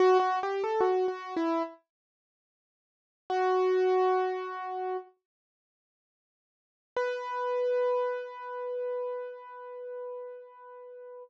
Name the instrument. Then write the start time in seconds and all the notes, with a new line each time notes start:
acoustic grand piano
0.00 F#4
0.20 F#4
0.43 G4
0.64 A4
0.80 F#4
1.08 F#4
1.36 E4
3.30 F#4
6.97 B4